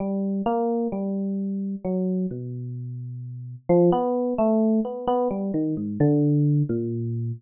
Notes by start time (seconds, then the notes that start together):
0.00 G3
0.46 A#3
0.92 G3
1.85 F#3
2.31 B2
3.69 F3
3.92 B3
4.38 A3
4.85 B3
5.08 B3
5.31 G3
5.54 D#3
5.77 G#2
6.00 D3
6.69 A#2